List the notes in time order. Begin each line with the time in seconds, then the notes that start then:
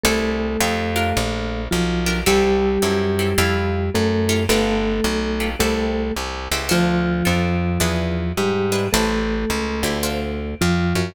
0.03 C2 A3 E4 G4 A4 C5
0.60 F2 D#4 F4 G4 A4
0.96 D4 F4 G4 A#4
1.17 A#1
1.71 B1 F3 F4
2.06 D4 F4 G4 A#4
2.26 C2 G3 C4 E4 G4 A4
2.82 F#2 C4 E4 G4 A4
3.19 C4 E4 G4 A4
3.38 F2 E4 F4 G4 A4
3.94 F#2 A3 A4
4.29 E4 F4 G4 A4
4.49 G1 A3 F4 G4 A4 B4
5.04 B1
5.40 F4 G4 A4 B4
5.59 C2 A3 E4 G4 A4 C5
6.16 C2
6.51 C#2 E4 G4 A4 C5
6.69 D2 F3 D4 F4 A4 C5
7.25 F2 D4 F4 A4 C5
7.80 E2 D4 E4 G#4 B4
8.37 G#2 G3 G4
8.72 D4 E4 G#4 B4
8.93 A1 A3 E4 G4 A4 C5
9.50 C#2
9.83 D2 E4 G4 A4 C5
10.03 D4 F4 A4 C5
10.61 F2 F3 F4
10.95 F#2